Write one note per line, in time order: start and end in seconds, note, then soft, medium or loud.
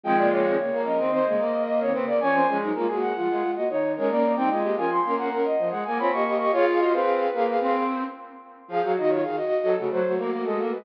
0.03 0.17 D#3 medium
0.03 0.56 F3 loud
0.03 0.56 G#3 loud
0.03 0.17 C4 medium
0.03 0.17 G5 loud
0.16 0.42 C#3 medium
0.16 0.42 A#3 medium
0.16 0.30 D5 loud
0.31 0.82 C#5 medium
0.44 0.57 D#3 medium
0.44 0.57 C4 medium
0.57 0.70 C#3 medium
0.57 0.70 A#3 medium
0.72 0.97 A#3 medium
0.85 0.98 F3 medium
0.85 0.98 C#4 medium
0.85 1.63 D#5 medium
0.98 1.23 D#3 medium
0.98 1.11 C4 medium
0.98 1.23 C4 medium
1.12 1.25 C4 loud
1.26 1.39 C#3 medium
1.26 1.40 G#3 medium
1.26 1.39 A#3 medium
1.38 1.90 A#3 medium
1.67 1.80 D#5 loud
1.80 1.93 D#3 medium
1.80 1.93 C4 medium
1.80 1.93 C#5 loud
1.92 2.18 C#3 medium
1.92 2.18 A#3 medium
1.92 2.05 C4 medium
1.92 2.06 B4 medium
2.07 2.20 A#3 medium
2.07 2.19 D5 loud
2.20 2.47 F3 medium
2.20 2.47 C#4 medium
2.20 2.34 C#4 loud
2.20 2.57 G#5 loud
2.33 2.46 C4 medium
2.47 2.60 F3 medium
2.47 2.72 G#3 loud
2.47 2.60 C#4 medium
2.61 2.74 F#3 medium
2.61 2.74 D#4 medium
2.74 2.86 G#3 medium
2.74 2.87 A#3 medium
2.74 2.86 F4 medium
2.87 3.12 G#3 medium
2.87 3.11 A#3 medium
2.87 3.11 F#4 medium
3.01 3.51 F#5 loud
3.16 3.28 F3 medium
3.16 3.27 G#3 medium
3.16 3.27 F4 medium
3.28 3.41 G#3 medium
3.28 3.43 G#3 medium
3.28 3.41 F4 medium
3.41 3.54 G#3 medium
3.41 3.54 F4 medium
3.56 3.68 A#3 medium
3.56 3.68 F#4 medium
3.56 3.69 D#5 medium
3.69 3.95 D#3 medium
3.69 3.92 C#5 medium
3.96 4.10 G#3 medium
3.96 4.31 C#4 medium
3.96 4.31 A#4 medium
3.96 4.09 C#5 medium
4.09 4.35 A#3 medium
4.09 4.33 D5 loud
4.36 4.49 G3 medium
4.36 4.49 C4 medium
4.36 4.49 D#4 medium
4.36 4.50 G5 loud
4.50 4.63 G#3 medium
4.50 4.76 G#3 medium
4.50 4.63 F4 medium
4.50 4.76 D#5 medium
4.64 4.76 A#3 medium
4.64 4.76 G4 medium
4.76 5.00 F3 medium
4.76 4.90 C#4 medium
4.76 4.90 A#4 medium
4.76 4.90 G#5 loud
4.91 5.16 C6 medium
5.04 5.36 A#3 medium
5.04 5.30 C#4 medium
5.04 5.30 A#4 medium
5.18 5.42 F#5 loud
5.31 5.53 C#4 medium
5.31 5.53 A#4 medium
5.45 5.68 D#5 medium
5.58 5.71 F3 medium
5.70 5.83 G#3 medium
5.70 5.84 F#5 medium
5.85 5.99 A#3 loud
5.85 5.98 G#5 loud
5.98 6.12 C4 medium
5.98 6.11 F4 medium
5.98 6.11 C#5 medium
5.98 6.11 B5 medium
6.12 6.46 A#3 medium
6.12 6.25 G4 medium
6.12 6.25 D#5 medium
6.12 6.35 C#6 medium
6.25 6.38 G4 medium
6.25 6.38 D#5 medium
6.39 6.52 G4 medium
6.39 6.52 D#5 medium
6.39 6.52 C#6 medium
6.52 6.92 F4 loud
6.52 6.65 G#4 medium
6.52 6.65 C#5 loud
6.52 6.65 F5 medium
6.67 6.80 G#4 medium
6.67 6.80 F5 medium
6.79 6.92 F#4 medium
6.79 6.92 D#5 medium
6.92 7.27 C4 medium
6.92 7.30 G#4 medium
6.92 7.73 B4 loud
6.92 7.30 F5 medium
7.34 7.55 A#3 medium
7.34 7.47 G#4 medium
7.34 7.47 F5 medium
7.48 7.83 G#4 medium
7.48 7.83 F5 medium
7.60 8.03 C4 loud
8.68 8.81 F3 loud
8.68 8.81 F4 loud
8.68 8.92 G#4 medium
8.68 8.92 F5 medium
8.83 8.96 F#3 loud
8.83 9.18 F#4 loud
8.97 9.24 D#3 loud
8.97 9.10 F#4 medium
8.97 9.10 D#5 medium
9.08 9.21 F4 medium
9.08 9.21 C#5 medium
9.23 9.37 D#3 medium
9.23 9.36 G#4 medium
9.23 9.36 F5 medium
9.36 9.74 F#4 medium
9.36 9.74 D#5 medium
9.63 9.76 F#3 loud
9.63 9.89 A4 loud
9.77 9.91 C#3 medium
9.77 10.00 A3 medium
9.77 10.00 F#4 medium
9.91 10.04 F#3 loud
9.91 10.14 C5 medium
10.04 10.18 F#3 medium
10.04 10.78 A3 medium
10.04 10.78 F#4 medium
10.17 10.30 A#3 loud
10.30 10.43 A#3 medium
10.45 10.58 G#3 medium
10.45 10.70 A4 loud
10.59 10.72 A#3 medium
10.71 10.85 G#3 medium
10.71 10.84 B4 medium